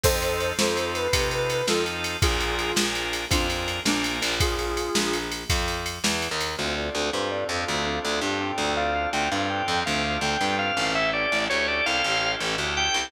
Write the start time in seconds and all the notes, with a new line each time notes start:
0.04 F2 C4 D#4 F4 A4 C5, kick, crash
0.22 ride
0.40 ride
0.58 F2 C4 D#4 F4 A4 C5, snare
0.77 ride
0.95 B4, ride
1.13 C3 C4 D#4 F4 A4, kick, ride
1.31 B4, ride
1.50 ride
1.67 F2 C4 D#4 F4 A4, snare
1.86 ride
2.04 ride
2.22 A#1 D4 F4 G#4 A#4, kick, ride
2.41 ride
2.59 ride
2.76 A#1 D4 F4 G#4 A#4, snare
2.95 ride
3.13 ride
3.31 F2 D4 F4 G#4 A#4, kick, ride
3.50 ride
3.68 ride
3.85 A#1 A#3 D4 F4 G#4 A#4, snare
4.04 ride
4.22 A#1, ride
4.40 F4 G#4, kick, ride
4.59 ride
4.77 ride
4.95 A#1, snare
5.13 ride
5.32 ride
5.50 F2, kick, ride
5.68 ride
5.86 ride
6.04 E2, snare
6.22 ride
6.31 D#2
6.40 ride
6.58 D2 C4 D4 F4 A4 F5
6.77 C4 D4 F4 A4 D5
6.95 D2 C4 D4 F4 A4
7.13 G2 C4 D4 F4 A4 C5
7.31 C4 D4 F4 A4 D5
7.49 F2 C4 D4 F4 A4 F5
7.68 D2
7.86 C4 D4 F4 A4
8.05 D2
8.21 G2 C4 D4 F4 A4
8.40 C4 D4 F4 A4 G5
8.58 D2 C4 D4 F4 A4
8.77 C4 D4 F4 A4 F5
8.95 C4 D4 F4 A4
9.13 D2 C4 D4 F4 A4 G5
9.31 G2 C4 D4 F4 A4 F5
9.50 C4 D4 F4 A4 G5
9.68 F2
9.86 D2 C4 D4 F4 A4 F5
10.04 C4 D4 F4 A4
10.21 D2 G5
10.41 G2 C4 D4 F4 A4
10.59 C4 D4 F4 A4 F5
10.77 A1 C4 D4 F4 A4
10.95 C#4 E4 G4 A4 E5
11.13 C#4 E4 G4 A4 D5
11.32 A1 C#4 E4 G4 A4
11.50 D2 C#4 E4 G4 A4 C#5
11.68 C#4 E4 G4 A4 D5
11.86 C2 C#4 E4 G4 A4 F5
12.04 A1
12.22 C#4 E4 G4 A4
12.40 A1
12.58 D2 C#4 E4 G4 A4
12.77 C#4 E4 G4 A4 G5
12.94 C2 C#4 E4 G4 A4